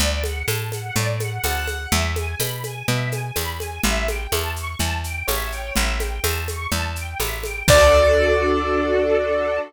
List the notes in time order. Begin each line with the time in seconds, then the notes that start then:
0.00 D2 D5, low conga, shaker
0.24 F#5, high conga, shaker
0.48 A2 A5, tambourine, high conga, shaker
0.72 F#5, high conga, shaker
0.96 A2 D5, low conga, shaker
1.20 F#5, high conga, shaker
1.44 D2 F#5 A5, tambourine, high conga, shaker
1.68 F#5, high conga, shaker
1.92 E2 E5, low conga, shaker
2.16 G#5, high conga, shaker
2.40 B2 B5, tambourine, high conga, shaker
2.64 G#5, high conga, shaker
2.88 B2 E5, low conga, shaker
3.12 G#5, high conga, shaker
3.36 E2 B5, tambourine, high conga, shaker
3.60 G#5, high conga, shaker
3.83 A1 E5, low conga, shaker
4.08 G5, high conga, shaker
4.32 E2 A5, tambourine, high conga, shaker
4.56 C#6, shaker
4.79 E2 A5, low conga, shaker
5.04 G5, shaker
5.28 A1 C#5 E5, tambourine, high conga, shaker
5.52 G5, shaker
5.76 A1 E5, low conga, shaker
6.00 G5, high conga, shaker
6.24 E2 A5, tambourine, high conga, shaker
6.48 C#6, high conga, shaker
6.72 E2 A5, low conga, shaker
6.96 G5, shaker
7.20 A1 E5, tambourine, high conga, shaker
7.44 G5, high conga, shaker
7.68 D2 D4 F#4 A4 D5, kick, crash